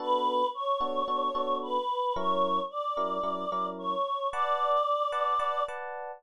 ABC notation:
X:1
M:4/4
L:1/8
Q:1/4=111
K:Bm
V:1 name="Choir Aahs"
B2 c4 B2 | c2 d4 c2 | d5 z3 |]
V:2 name="Electric Piano 1"
[B,DFA]3 [B,DFA] [B,DFA] [B,DFA]3 | [F,CE^A]3 [F,CEA] [F,CEA] [F,CEA]3 | [Bdfa]3 [Bdfa] [Bdfa] [Bdfa]3 |]